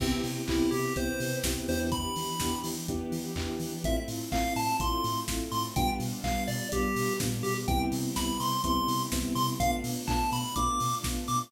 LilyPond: <<
  \new Staff \with { instrumentName = "Lead 1 (square)" } { \time 4/4 \key c \major \tempo 4 = 125 c'16 r8. e'8 g'8 c''4 r8 c''16 r16 | b''4. r2 r8 | e''16 r8. f''8 a''8 c'''4 r8 c'''16 r16 | g''16 r8. f''8 d''8 g'4 r8 g'16 r16 |
g''16 r8. b''8 c'''8 c'''4 r8 c'''16 r16 | f''16 r8. a''8 b''8 d'''4 r8 d'''16 r16 | }
  \new Staff \with { instrumentName = "Electric Piano 2" } { \time 4/4 \key c \major <b c' e' g'>4 <b c' e' g'>4 <b c' e' g'>4 <b c' e' g'>8 <b d' e' g'>8~ | <b d' e' g'>4 <b d' e' g'>4 <b d' e' g'>4 <b d' e' g'>4 | <a c' e' f'>4 <a c' e' f'>4 <a c' e' f'>4 <a c' e' f'>4 | <g b d' f'>4 <g b d' f'>4 <g b d' f'>4 <g b d' f'>4 |
<g b c' e'>4 <g b c' e'>4 <g b c' e'>4 <g b c' e'>4 | <a b d' f'>4 <a b d' f'>4 <a b d' f'>4 <a b d' f'>4 | }
  \new Staff \with { instrumentName = "Synth Bass 1" } { \clef bass \time 4/4 \key c \major c,8 c8 c,8 c8 c,8 c8 c,8 e,8~ | e,8 e8 e,8 e8 e,8 e8 e,8 e8 | a,,8 a,8 a,,8 a,8 a,,8 a,8 a,,8 a,8 | b,,8 b,8 b,,8 b,8 b,,8 b,8 ais,8 b,8 |
c,8 c8 c,8 c8 c,8 c8 c,8 c8 | b,,8 b,8 b,,8 b,8 b,,8 b,8 b,,8 b,8 | }
  \new Staff \with { instrumentName = "String Ensemble 1" } { \time 4/4 \key c \major <b c' e' g'>2 <b c' g' b'>2 | <b d' e' g'>2 <b d' g' b'>2 | <a c' e' f'>2 <a c' f' a'>2 | <g b d' f'>2 <g b f' g'>2 |
<b c' e' g'>1 | <a b d' f'>1 | }
  \new DrumStaff \with { instrumentName = "Drums" } \drummode { \time 4/4 <cymc bd>8 hho8 <hc bd>8 hho8 <hh bd>8 hho8 <bd sn>8 hho8 | <hh bd>8 hho8 <bd sn>8 hho8 <hh bd>8 hho8 <hc bd>8 hho8 | <hh bd>8 hho8 <hc bd>8 hho8 <hh bd>8 hho8 <bd sn>8 hho8 | <hh bd>8 hho8 <hc bd>8 hho8 <hh bd>8 hho8 <bd sn>8 hho8 |
<hh bd>8 hho8 <bd sn>8 hho8 <hh bd>8 hho8 <bd sn>8 hho8 | <hh bd>8 hho8 <hc bd>8 hho8 <hh bd>8 hho8 <bd sn>8 hho8 | }
>>